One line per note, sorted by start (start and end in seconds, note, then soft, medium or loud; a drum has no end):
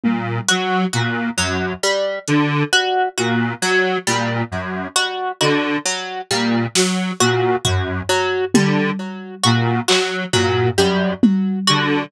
0.04 0.39 A#2 medium
0.04 high tom medium
0.49 0.85 F#3 medium
0.49 0.84 F#4 medium
0.49 closed hi-hat medium
0.93 1.29 A#2 medium
0.93 1.29 F#4 medium
1.37 1.73 F#2 medium
1.37 1.74 F#3 medium
1.83 2.19 G3 medium
2.27 2.63 D3 medium
2.27 closed hi-hat medium
2.73 3.09 F#4 medium
3.18 3.53 A#2 medium
3.18 3.54 F#4 medium
3.62 3.98 F#3 medium
4.07 4.43 A#2 medium
4.07 4.43 G3 medium
4.51 4.87 F#2 medium
4.96 5.32 F#4 medium
4.96 cowbell soft
5.41 5.77 D3 medium
5.41 5.76 F#4 medium
5.41 cowbell medium
5.86 6.21 F#3 medium
6.30 6.66 A#2 medium
6.30 6.67 G3 medium
6.75 7.11 F#3 medium
6.75 snare medium
7.20 7.56 A#2 medium
7.20 7.56 F#4 medium
7.65 8.01 F#2 medium
7.65 8.01 F#4 medium
7.65 floor tom medium
8.09 8.45 F#3 medium
8.54 8.90 D3 medium
8.54 8.91 G3 medium
8.54 high tom loud
9.43 9.80 A#2 medium
9.43 9.79 F#4 medium
9.88 10.25 F#3 medium
9.88 10.24 F#4 medium
9.88 clap medium
10.33 10.69 A#2 medium
10.33 10.69 F#3 medium
10.33 floor tom medium
10.77 11.13 F#2 medium
10.77 11.14 G3 medium
11.23 high tom loud
11.67 12.04 D3 medium
11.67 12.03 F#4 medium